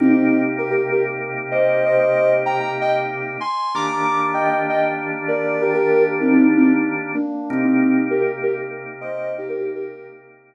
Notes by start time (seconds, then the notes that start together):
0.00 C3 A#3 C4 D#4 G4
0.09 C4 D#4
0.58 G4 A#4
0.70 G4 A#4
0.91 G4 A#4
1.51 C5 D#5
1.85 C5 D#5
1.98 C5 D#5
2.46 G5 A#5
2.59 G5 A#5
2.81 D#5 G5
3.40 G#5 C6
3.75 D#3 A#3 D4 G4 A#5 D6
3.87 A#5 D6
4.34 D#5 G5
4.44 D#5 G5
4.69 D#5 G5
5.28 A#4 D5
5.61 G4 A#4
5.74 G4 A#4
6.21 C4 D#4
6.31 C4 D#4
6.57 C4 D#4
7.14 A#3 D4
7.50 C3 A#3 C4 D#4 G4
7.64 C4 D#4
8.10 G4 A#4
8.20 G4 A#4
8.43 G4 A#4
9.01 C5 D#5
9.38 D#4 G4
9.49 G4 A#4
9.60 D#4 G4
9.75 G4 A#4